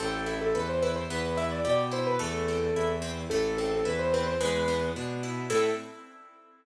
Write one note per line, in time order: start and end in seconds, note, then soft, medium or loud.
0.00 0.50 A1 loud
0.00 0.24 C4 loud
0.00 0.25 A4 loud
0.26 0.51 E4 medium
0.26 0.41 A4 medium
0.41 0.54 A4 medium
0.54 1.04 E2 medium
0.54 0.80 A4 medium
0.54 0.68 B4 medium
0.69 0.82 C5 medium
0.82 1.07 E4 medium
0.82 0.96 B4 medium
0.96 1.09 C5 medium
1.10 1.60 E2 loud
1.10 1.35 B3 loud
1.10 1.37 B4 medium
1.37 1.62 E4 medium
1.37 1.50 E5 medium
1.51 1.64 D5 medium
1.65 2.15 B2 medium
1.65 1.89 G4 loud
1.65 1.78 D5 medium
1.92 2.16 E4 medium
1.92 2.06 C5 medium
2.07 2.20 B4 medium
2.19 2.69 E2 medium
2.19 2.44 A3 loud
2.19 2.90 A4 loud
2.48 2.73 C4 medium
2.75 3.25 E2 medium
2.75 3.01 E4 medium
3.02 3.27 C4 loud
3.30 3.80 A1 loud
3.30 3.56 A3 loud
3.30 3.56 A4 medium
3.57 3.83 C4 medium
3.57 3.71 A4 medium
3.71 3.84 A4 medium
3.85 4.35 E2 medium
3.85 4.10 E4 loud
3.85 3.98 B4 medium
3.99 4.12 C5 medium
4.13 4.39 C4 medium
4.13 4.26 B4 medium
4.26 4.40 C5 medium
4.41 4.90 E2 medium
4.41 4.65 G#3 loud
4.41 4.91 B4 loud
4.68 4.93 B3 loud
4.96 5.45 B2 medium
4.96 5.21 D4 medium
5.23 5.48 E4 loud
5.50 5.70 A2 loud
5.50 5.69 C4 loud
5.50 5.69 E4 loud
5.50 5.69 A4 loud
5.50 5.70 A4 loud